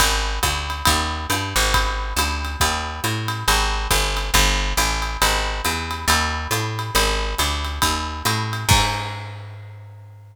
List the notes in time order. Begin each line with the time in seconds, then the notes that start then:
0.00 G#1, kick, ride
0.43 D2, kick, hi-hat pedal, ride
0.70 ride
0.85 D#2, kick, ride
1.30 G2, hi-hat pedal, ride
1.56 G#1, ride
1.74 kick, ride
2.16 D2, hi-hat pedal, ride
2.45 ride
2.60 D#2, kick, ride
3.04 A2, hi-hat pedal, ride
3.28 ride
3.48 G#1, ride
3.91 G1, kick, hi-hat pedal, ride
4.17 ride
4.34 G1, kick, ride
4.77 A1, hi-hat pedal, ride
5.02 ride
5.22 G#1, ride
5.65 E2, hi-hat pedal, ride
5.91 ride
6.08 D#2, ride
6.51 A2, hi-hat pedal, ride
6.79 ride
6.95 G#1, ride
7.38 D2, hi-hat pedal, ride
7.65 ride
7.82 D#2, kick, ride
8.25 A2, hi-hat pedal, ride
8.53 ride
8.69 G#2, kick, crash